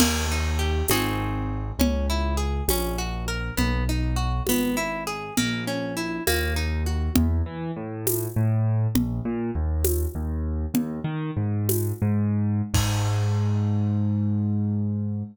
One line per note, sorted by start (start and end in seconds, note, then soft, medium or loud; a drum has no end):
0.00 0.82 D#2 medium
0.00 0.26 A#3 medium
0.00 crash loud
0.00 low conga loud
0.32 0.58 D#4 medium
0.59 0.86 G4 medium
0.88 1.72 G#1 medium
0.88 1.71 C4 medium
0.88 1.71 D#4 medium
0.88 1.71 F#4 medium
0.88 1.71 G#4 medium
0.88 tambourine medium
0.88 high conga loud
1.79 2.61 C#2 medium
1.79 2.06 C#4 medium
1.79 low conga loud
2.10 2.36 E4 medium
2.37 2.64 G#4 medium
2.68 3.51 A#1 medium
2.68 2.97 C#4 medium
2.68 tambourine medium
2.68 high conga loud
2.98 3.25 F#4 medium
3.28 3.55 A#4 medium
3.57 4.41 B1 medium
3.57 3.84 B3 medium
3.57 low conga loud
3.89 4.16 D#4 medium
4.16 4.43 F#4 medium
4.47 5.30 G#1 medium
4.47 4.76 B3 medium
4.47 tambourine medium
4.47 high conga medium
4.77 5.04 E4 medium
5.07 5.34 G#4 medium
5.37 6.20 A#1 medium
5.37 5.64 A#3 medium
5.37 low conga loud
5.67 5.94 C#4 medium
5.97 6.24 E4 medium
6.27 7.09 D#2 medium
6.27 6.54 A#3 medium
6.27 tambourine medium
6.27 high conga medium
6.56 6.83 D#4 medium
6.86 7.13 F#4 medium
7.16 7.42 E2 medium
7.16 low conga loud
7.46 7.71 E3 medium
7.76 8.27 A2 medium
8.07 tambourine medium
8.07 high conga loud
8.36 8.87 A2 medium
8.95 9.20 A#1 medium
8.95 low conga loud
9.25 9.51 A#2 medium
9.55 10.06 D#2 medium
9.84 tambourine medium
9.84 high conga loud
10.15 10.66 D#2 medium
10.74 11.00 D#2 medium
10.74 low conga loud
11.04 11.31 D#3 medium
11.37 11.92 G#2 medium
11.69 tambourine medium
11.69 high conga loud
12.02 12.62 G#2 medium
12.74 15.23 G#2 loud
12.74 kick loud
12.74 crash loud